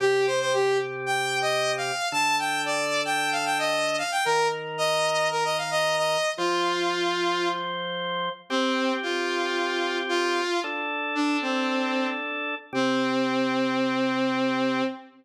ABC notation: X:1
M:4/4
L:1/16
Q:1/4=113
K:Cdor
V:1 name="Lead 2 (sawtooth)"
G2 c c G2 z2 (3g4 e4 f4 | a2 g2 d3 g2 f g e3 f g | B2 z2 e4 B e f e2 e3 | F10 z6 |
C4 F8 F4 | z4 D2 C6 z4 | C16 |]
V:2 name="Drawbar Organ"
[C,CG]16 | [D,DA]16 | [E,EB]16 | [F,Fc]16 |
[CGc]16 | [DAd]16 | [C,CG]16 |]